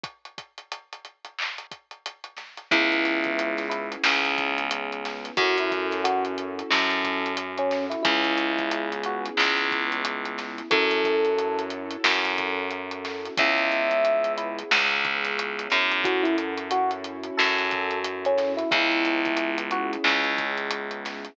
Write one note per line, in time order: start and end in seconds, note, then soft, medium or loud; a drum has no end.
0.03 kick loud
0.03 closed hi-hat medium
0.25 closed hi-hat medium
0.38 kick medium
0.38 closed hi-hat medium
0.58 closed hi-hat medium
0.72 closed hi-hat medium
0.93 closed hi-hat medium
1.05 closed hi-hat medium
1.25 closed hi-hat medium
1.38 clap loud
1.58 closed hi-hat medium
1.71 kick medium
1.71 closed hi-hat medium
1.91 closed hi-hat medium
2.06 closed hi-hat medium
2.24 closed hi-hat medium
2.37 snare soft
2.37 closed hi-hat medium
2.57 closed hi-hat medium
2.71 3.96 C#2 medium
2.71 5.33 B3 medium
2.71 5.33 C#4 medium
2.71 5.33 E4 medium
2.71 3.65 E4 loud
2.71 5.33 G#4 medium
2.71 kick loud
2.71 closed hi-hat loud
2.92 closed hi-hat medium
3.05 snare soft
3.05 closed hi-hat medium
3.24 kick medium
3.24 closed hi-hat medium
3.39 closed hi-hat loud
3.57 snare soft
3.57 closed hi-hat medium
3.69 3.89 E4 medium
3.69 closed hi-hat medium
3.92 closed hi-hat medium
4.03 5.30 C#2 medium
4.03 snare loud
4.25 closed hi-hat medium
4.38 kick medium
4.38 closed hi-hat medium
4.58 closed hi-hat medium
4.71 closed hi-hat loud
4.92 closed hi-hat medium
5.05 snare medium
5.05 closed hi-hat medium
5.25 closed hi-hat medium
5.37 6.62 F#2 medium
5.37 8.01 C#4 medium
5.37 8.01 E4 medium
5.37 5.56 F#4 loud
5.37 8.01 F#4 medium
5.37 8.01 A4 medium
5.37 kick loud
5.37 closed hi-hat medium
5.58 5.71 E4 loud
5.58 closed hi-hat medium
5.71 kick medium
5.71 snare soft
5.71 closed hi-hat medium
5.91 snare soft
5.91 closed hi-hat medium
6.04 6.23 F#4 loud
6.04 closed hi-hat loud
6.25 closed hi-hat medium
6.38 closed hi-hat medium
6.59 closed hi-hat medium
6.70 7.95 F#2 medium
6.70 7.33 A4 medium
6.70 snare loud
6.90 closed hi-hat medium
7.04 kick medium
7.04 closed hi-hat medium
7.26 closed hi-hat medium
7.37 closed hi-hat loud
7.58 7.85 C#4 loud
7.58 closed hi-hat medium
7.71 snare medium
7.71 closed hi-hat medium
7.90 8.02 E4 loud
7.90 closed hi-hat medium
8.03 9.30 C#2 loud
8.03 10.68 B3 medium
8.03 10.68 C#4 medium
8.03 8.90 E4 loud
8.03 10.68 E4 medium
8.03 10.68 G#4 medium
8.03 kick loud
8.03 closed hi-hat loud
8.24 closed hi-hat medium
8.38 closed hi-hat medium
8.58 kick medium
8.58 closed hi-hat medium
8.71 closed hi-hat loud
8.92 closed hi-hat medium
9.03 9.25 F#4 loud
9.03 closed hi-hat medium
9.25 closed hi-hat medium
9.37 10.62 C#2 medium
9.37 snare loud
9.57 closed hi-hat medium
9.71 kick medium
9.71 closed hi-hat medium
9.92 closed hi-hat medium
10.05 closed hi-hat loud
10.25 closed hi-hat medium
10.38 snare medium
10.38 closed hi-hat medium
10.58 closed hi-hat medium
10.71 11.96 F#2 loud
10.71 13.33 C#4 medium
10.71 13.33 E4 medium
10.71 13.33 F#4 medium
10.71 13.33 A4 medium
10.71 11.61 A4 loud
10.71 kick loud
10.71 closed hi-hat loud
10.91 closed hi-hat medium
11.04 kick medium
11.04 closed hi-hat medium
11.25 closed hi-hat medium
11.38 closed hi-hat medium
11.59 closed hi-hat medium
11.70 closed hi-hat medium
11.91 closed hi-hat medium
12.04 13.29 F#2 medium
12.04 snare loud
12.25 closed hi-hat medium
12.38 kick medium
12.38 closed hi-hat medium
12.71 closed hi-hat medium
12.91 closed hi-hat medium
13.05 snare medium
13.05 closed hi-hat medium
13.25 closed hi-hat medium
13.37 14.63 C#2 loud
13.37 16.01 B3 medium
13.37 16.01 C#4 medium
13.37 16.01 E4 medium
13.37 16.01 G#4 medium
13.37 14.33 E5 loud
13.37 kick loud
13.37 closed hi-hat loud
13.58 closed hi-hat medium
13.72 closed hi-hat medium
13.91 closed hi-hat medium
14.05 closed hi-hat medium
14.24 closed hi-hat medium
14.37 14.57 E4 loud
14.37 closed hi-hat medium
14.58 closed hi-hat medium
14.71 15.68 C#2 medium
14.71 snare loud
14.91 closed hi-hat medium
15.05 kick medium
15.05 closed hi-hat medium
15.24 snare soft
15.24 closed hi-hat medium
15.39 closed hi-hat loud
15.59 closed hi-hat medium
15.70 17.30 F#2 medium
15.70 snare medium
15.70 closed hi-hat medium
15.91 closed hi-hat medium
16.04 18.67 C#4 medium
16.04 18.67 E4 medium
16.04 18.67 F#4 medium
16.04 16.24 F#4 loud
16.04 18.67 A4 medium
16.04 kick loud
16.04 closed hi-hat loud
16.23 16.36 E4 loud
16.23 closed hi-hat medium
16.38 closed hi-hat medium
16.57 closed hi-hat medium
16.71 16.91 F#4 loud
16.71 closed hi-hat loud
16.91 closed hi-hat medium
17.04 closed hi-hat medium
17.23 closed hi-hat medium
17.37 18.63 F#2 medium
17.37 17.98 A4 loud
17.37 snare loud
17.58 closed hi-hat medium
17.71 kick medium
17.71 closed hi-hat medium
17.91 closed hi-hat medium
18.04 closed hi-hat loud
18.25 18.53 C#4 loud
18.25 closed hi-hat medium
18.38 snare medium
18.38 closed hi-hat medium
18.57 18.69 E4 loud
18.57 closed hi-hat medium
18.71 19.97 C#2 loud
18.71 21.34 B3 medium
18.71 21.34 C#4 medium
18.71 19.58 E4 loud
18.71 21.34 E4 medium
18.71 21.34 G#4 medium
18.71 kick loud
18.71 closed hi-hat loud
18.91 closed hi-hat medium
19.05 closed hi-hat medium
19.25 kick medium
19.25 closed hi-hat medium
19.37 closed hi-hat loud
19.58 closed hi-hat medium
19.71 19.91 F#4 loud
19.71 closed hi-hat medium
19.93 closed hi-hat medium
20.04 21.29 C#2 medium
20.04 clap loud
20.24 closed hi-hat medium
20.38 kick medium
20.38 closed hi-hat medium
20.57 closed hi-hat medium
20.71 closed hi-hat loud
20.91 closed hi-hat medium
21.05 snare medium
21.05 closed hi-hat medium
21.25 closed hi-hat medium